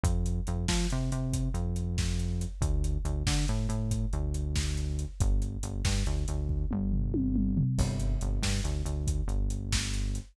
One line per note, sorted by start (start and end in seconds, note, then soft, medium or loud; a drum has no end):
0.03 0.40 F2 medium
0.03 kick loud
0.03 closed hi-hat loud
0.26 closed hi-hat medium
0.47 0.66 F2 medium
0.47 closed hi-hat medium
0.68 0.87 F3 medium
0.68 kick medium
0.68 snare loud
0.90 1.11 C3 medium
0.90 closed hi-hat medium
1.12 1.49 C3 medium
1.12 closed hi-hat medium
1.33 kick medium
1.33 closed hi-hat loud
1.54 2.45 F2 medium
1.54 closed hi-hat medium
1.76 closed hi-hat medium
1.98 kick medium
1.98 snare medium
2.19 closed hi-hat medium
2.41 closed hi-hat medium
2.61 2.97 D2 medium
2.61 kick loud
2.61 closed hi-hat medium
2.84 closed hi-hat medium
3.05 3.23 D2 medium
3.05 closed hi-hat medium
3.27 3.45 D3 medium
3.27 kick medium
3.27 snare loud
3.48 3.67 A2 medium
3.48 closed hi-hat medium
3.69 4.05 A2 medium
3.69 closed hi-hat medium
3.91 kick medium
3.91 closed hi-hat medium
4.13 5.05 D2 medium
4.13 closed hi-hat medium
4.34 closed hi-hat medium
4.56 kick medium
4.56 snare loud
4.77 closed hi-hat medium
4.99 closed hi-hat medium
5.20 5.57 G1 medium
5.20 kick loud
5.20 closed hi-hat medium
5.42 closed hi-hat medium
5.63 5.82 G1 medium
5.63 closed hi-hat medium
5.85 6.03 G2 medium
5.85 kick medium
5.85 snare loud
6.06 6.25 D2 medium
6.06 closed hi-hat medium
6.28 6.65 D2 medium
6.28 closed hi-hat medium
6.49 kick medium
6.71 7.63 G1 medium
6.71 mid tom medium
6.92 floor tom medium
7.14 high tom medium
7.36 mid tom medium
7.57 floor tom loud
7.78 8.16 G1 medium
7.78 kick loud
7.78 crash medium
8.00 closed hi-hat medium
8.21 8.40 G1 medium
8.21 closed hi-hat medium
8.42 8.61 G2 medium
8.42 kick medium
8.42 snare loud
8.64 8.82 D2 medium
8.64 closed hi-hat medium
8.85 9.22 D2 medium
8.85 closed hi-hat medium
9.07 kick medium
9.07 closed hi-hat medium
9.28 10.19 G1 medium
9.28 closed hi-hat medium
9.50 closed hi-hat medium
9.72 kick medium
9.72 snare loud
9.94 closed hi-hat medium
10.15 closed hi-hat medium